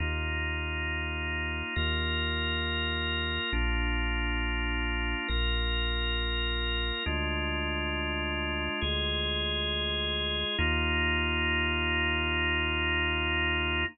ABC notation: X:1
M:4/4
L:1/8
Q:1/4=68
K:Eb
V:1 name="Drawbar Organ"
[B,EF]4 [B,FB]4 | [B,DF]4 [B,FB]4 | [A,DF]4 [A,FA]4 | [B,EF]8 |]
V:2 name="Synth Bass 2" clef=bass
E,,4 E,,4 | B,,,4 B,,,4 | D,,4 D,,4 | E,,8 |]